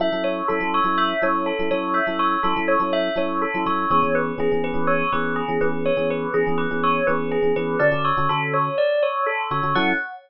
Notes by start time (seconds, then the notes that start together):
0.00 F#3 C#4 E4 A4 E5
0.12 F#3 C#4 E4 A4
0.24 C#5
0.48 F#3 C#4 E4 A4
0.60 F#3 C#4 E4 A4
0.74 C#5
0.84 F#3 C#4 E4 A4
0.98 E5
1.22 F#3 C#4 E4 A4 C#5
1.46 A4
1.59 F#3 C#4 E4 A4
1.71 F#3 C#4 E4 A4 C#5
1.94 E5
2.07 F#3 C#4 E4 A4
2.19 C#5
2.43 F#3 C#4 E4 A4
2.56 F#3 C#4 E4 A4
2.68 C#5
2.79 F#3 C#4 E4 A4
2.93 E5
3.16 F#3 C#4 E4 A4 C#5
3.42 A4
3.54 F#3 C#4 E4 A4
3.66 F#3 C#4 E4 A4 C#5
3.90 E3 B3 C#4 G#4 C#5
4.03 E3 B3 C#4 G#4
4.15 B4
4.38 E3 B3 C#4 G#4
4.52 E3 B3 C#4 G#4
4.64 B4
4.74 E3 B3 C#4 G#4
4.87 C#5
5.12 E3 B3 C#4 G#4 B4
5.36 G#4
5.48 E3 B3 C#4 G#4
5.61 E3 B3 C#4 G#4 B4
5.86 C#5
5.97 E3 B3 C#4 G#4
6.10 B4
6.34 E3 B3 C#4 G#4
6.47 E3 B3 C#4 G#4
6.58 B4
6.71 E3 B3 C#4 G#4
6.84 C#5
7.07 E3 B3 C#4 G#4 B4
7.32 G#4
7.42 E3 B3 C#4 G#4
7.56 E3 B3 C#4 G#4 B4
7.79 D3 C#4 F#4 A4 D5
7.91 D3 C#4 F#4 A4
8.05 C#5
8.17 D3 C#4 F#4 A4
8.29 D3 C#4 F#4 A4
8.54 C#5
8.78 D5
9.03 C#5
9.26 A4
9.51 D3 C#4 F#4 A4 C#5
9.63 D3 C#4 F#4 A4
9.75 F#3 C#4 E4 A4 F#5